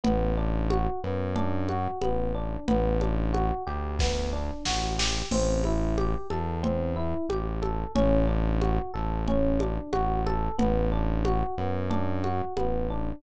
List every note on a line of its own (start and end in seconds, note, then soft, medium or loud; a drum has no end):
0.04 0.88 A1 loud
0.04 0.33 B3 medium
0.04 low conga medium
0.37 0.67 D4 medium
0.70 1.00 F#4 medium
0.70 high conga medium
1.04 1.88 F#2 loud
1.04 1.33 B3 medium
1.35 1.65 D4 medium
1.35 low conga medium
1.69 1.99 F#4 medium
1.69 high conga medium
2.01 2.57 A1 medium
2.01 2.31 B3 medium
2.01 high conga medium
2.35 2.64 D4 medium
2.68 3.52 A1 loud
2.68 2.97 B3 medium
2.68 low conga medium
3.01 3.30 D4 medium
3.01 high conga medium
3.33 3.63 F#4 medium
3.33 high conga medium
3.67 4.51 D2 medium
3.67 3.96 G4 medium
3.99 4.30 B3 medium
3.99 kick medium
3.99 snare medium
4.33 4.62 D4 medium
4.65 5.23 A1 medium
4.65 4.95 F#4 medium
4.65 snare medium
4.98 5.28 G4 medium
4.98 snare medium
5.31 6.16 A1 loud
5.31 5.61 C4 medium
5.31 crash medium
5.31 low conga medium
5.64 5.95 E4 medium
5.64 high conga medium
5.97 6.27 G4 medium
5.97 high conga medium
6.30 7.14 E2 medium
6.30 6.60 A4 medium
6.30 high conga medium
6.63 6.93 C4 medium
6.63 low conga medium
6.96 7.26 E4 medium
7.29 7.85 A1 medium
7.29 7.59 G4 medium
7.29 high conga medium
7.62 7.92 A4 soft
7.62 high conga medium
7.95 8.79 A1 loud
7.95 8.25 C#4 medium
7.95 low conga medium
8.27 8.57 D4 medium
8.61 8.91 F#4 soft
8.61 high conga medium
8.94 9.79 A1 loud
8.94 9.23 A4 soft
9.28 9.57 C#4 medium
9.28 low conga medium
9.60 9.90 D4 medium
9.60 high conga medium
9.92 10.49 A1 loud
9.92 10.22 F#4 medium
9.92 high conga medium
10.26 10.56 A4 medium
10.26 high conga medium
10.58 11.43 A1 loud
10.58 10.88 B3 medium
10.58 low conga medium
10.92 11.22 D4 medium
11.25 11.55 F#4 medium
11.25 high conga medium
11.58 12.42 F#2 loud
11.58 11.88 B3 medium
11.90 12.20 D4 medium
11.90 low conga medium
12.24 12.53 F#4 medium
12.24 high conga medium
12.57 13.13 A1 medium
12.57 12.86 B3 medium
12.57 high conga medium
12.90 13.20 D4 medium